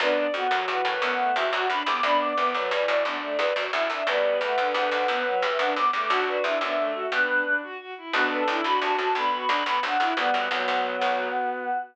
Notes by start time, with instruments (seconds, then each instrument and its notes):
0.00 harpsichord D2 F#2, violin B3 D4 B4, choir aahs D5
0.17 violin D5
0.33 harpsichord F2, violin B3 F#4, choir aahs F#5
0.51 harpsichord D2 F#2, violin F#3 F#4
0.68 harpsichord E2 G2, violin E3, choir aahs F#5
0.85 harpsichord F#2 A2, violin B4
1.01 harpsichord D2 F#2, violin B3, choir aahs F#5
1.18 violin A3
1.36 harpsichord C2 E2, violin F#4, choir aahs E5
1.52 harpsichord D2 F#2, violin F#4, choir aahs F#5
1.69 harpsichord D2 F#2, violin D4, choir aahs B5
1.86 harpsichord C2 E2, violin B3, choir aahs D6
2.03 harpsichord D2 F#2, violin B3 D4 D5, choir aahs B5
2.20 violin D5, choir aahs D6
2.36 harpsichord C2 E2, violin B3 B4, choir aahs D6
2.54 harpsichord D2 F#2, violin F#3 B4, choir aahs D5
2.71 harpsichord E2 G2, violin E3, choir aahs D5
2.88 harpsichord F#2 A2, choir aahs D5, violin D5
3.04 harpsichord D2 F#2, violin B3 D4, choir aahs D5
3.21 violin A3
3.38 harpsichord C2 E2, violin B4
3.56 harpsichord D2 F#2, violin F#4
3.73 harpsichord D2 F#2, violin E4, choir aahs E5
3.90 harpsichord C2 E2, violin D4
4.07 harpsichord D2 F#2, violin G3 B3 B4, choir aahs D5
4.41 harpsichord E2 G2, violin A3, choir aahs F#5
4.58 harpsichord D2 F#2, violin D3
4.74 harpsichord C2 E2, violin D3, choir aahs F#5
4.91 harpsichord B1 D2
5.08 harpsichord D2 F#2, violin B3, choir aahs F#5
5.25 violin F#3
5.42 harpsichord E2 G2, choir aahs E5
5.59 harpsichord D2 F#2, violin D4, choir aahs F#5
5.76 harpsichord D2 F#2, violin B3, choir aahs D6
5.93 harpsichord E2 G2, violin A3, choir aahs D6
6.09 harpsichord B1 D2, violin D4 F#4, choir aahs F#5
6.27 violin B4, choir aahs D5
6.44 harpsichord C2 E2, violin D4 E4, choir aahs E5
6.61 harpsichord D2 F#2, violin B3 D4
6.77 violin A3
6.95 violin F#4
7.12 harpsichord G2 B2, violin B3 D4, choir aahs B4
7.29 violin D4
7.45 violin D4
7.63 violin F#4
7.80 violin F#4
7.97 violin E4
8.13 harpsichord B1 D2, violin B3 D4 F#4, choir aahs B4
8.31 choir aahs A4, violin B4
8.47 harpsichord B1 D2, violin D4 E4, choir aahs A4
8.64 harpsichord B1 D2, violin D4 F#4, choir aahs B5
8.81 harpsichord C2 E2, violin F#4, choir aahs A5
8.98 harpsichord D2 F#2, violin F#4, choir aahs A5
9.15 harpsichord B1 D2, violin B3 D4, choir aahs B5
9.32 violin F#4
9.48 harpsichord B1 D2, violin D4
9.66 harpsichord B1 D2, violin B3
9.83 harpsichord B1 D2, violin D4, choir aahs F#5
10.00 harpsichord B1 D2, violin E4
10.16 harpsichord B1 D2, violin G3 B3, choir aahs F#5
10.34 harpsichord D2 F#2, violin B3
10.51 harpsichord C2 E2, violin F#3, choir aahs F#4
10.68 harpsichord B1 D2
11.01 harpsichord B1 D2